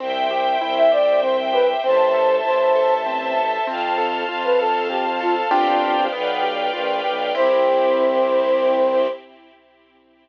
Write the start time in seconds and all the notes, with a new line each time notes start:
0.00 C2 C4 C5 E5 G5
0.31 G4
0.61 C2 E4
0.77 E5
0.92 G4 D5
1.22 C4 C5
1.53 G4 B4
1.84 A1 C4 C5 E5 A5
2.14 A4
2.45 A1 E4 C5
2.76 A4
3.06 C4
3.37 A4
3.67 F2 C4 C5 F5 A5
3.98 A4
4.29 F2 F4
4.44 B4
4.59 A4
4.90 C4 G4
5.20 F4 A4
5.51 G1 C4 D4 F4 G4 C5 D5 F5 G5
6.12 B1 B3 B4 D5 F5 G5
6.43 G4
6.73 A#1 F4
7.04 B1 G4
7.35 C2 C4 E4 G4 C5